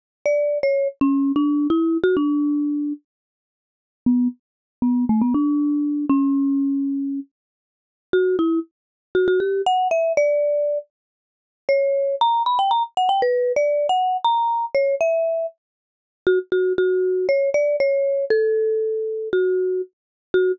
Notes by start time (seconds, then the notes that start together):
0.26 D5
0.63 C#5
1.01 C#4
1.36 D4
1.70 E4
2.04 F#4
2.17 D4
4.06 B3
4.82 B3
5.09 A3
5.22 B3
5.34 D4
6.10 C#4
8.13 F#4
8.39 E4
9.15 F#4
9.28 F#4
9.40 G4
9.66 F#5
9.91 E5
10.17 D5
11.69 C#5
12.21 A#5
12.46 B5
12.59 G5
12.71 A#5
12.97 F#5
13.09 G5
13.22 B4
13.56 D5
13.89 F#5
14.24 A#5
14.75 C#5
15.01 E5
16.27 F#4
16.52 F#4
16.78 F#4
17.29 C#5
17.54 D5
17.80 C#5
18.30 A4
19.33 F#4
20.34 F#4